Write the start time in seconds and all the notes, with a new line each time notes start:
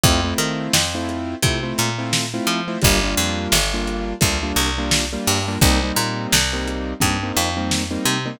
0.03 F2 A3 C4 E4 F4, kick, closed hi-hat
0.24 A3 C4 E4 F4
0.38 D#3, closed hi-hat
0.73 F2, snare
0.95 A3 C4 E4 F4
1.09 closed hi-hat
1.42 C3 A3 C4 E4 F4, kick, closed hi-hat
1.63 A3 C4 E4 F4
1.78 A#2, closed hi-hat
1.98 A3 C4 E4 F4
2.13 snare
2.34 A3 C4 E4 F4
2.47 F3, closed hi-hat
2.68 A3 C4 E4 F4
2.82 G1 G3 A#3 D4 F4, kick, closed hi-hat
3.03 G3 A#3 D4 F4
3.17 F2, closed hi-hat
3.52 G1, snare
3.74 G3 A#3 D4 F4
3.87 closed hi-hat
4.21 D2 G3 A#3 D4 F4, kick, closed hi-hat
4.43 G3 A#3 D4 F4
4.56 C2, closed hi-hat
4.78 G3 A#3 D4 F4
4.91 snare
5.13 G3 A#3 D4 F4
5.27 G2, snare, open hi-hat
5.48 G3 A#3 D4 F4
5.61 C2 G3 A#3 C4 D#4, kick, closed hi-hat
5.83 G3 A#3 C4 D#4
5.96 A#2, closed hi-hat
6.32 C2, snare
6.53 G3 A#3 C4 D#4
6.67 closed hi-hat
7.00 G2 G3 A#3 C4 D#4, kick, closed hi-hat
7.23 G3 A#3 C4 D#4
7.36 F2, closed hi-hat
7.57 G3 A#3 C4 D#4
7.71 snare
7.91 G3 A#3 C4 D#4
8.05 C3, closed hi-hat
8.25 G3 A#3 C4 D#4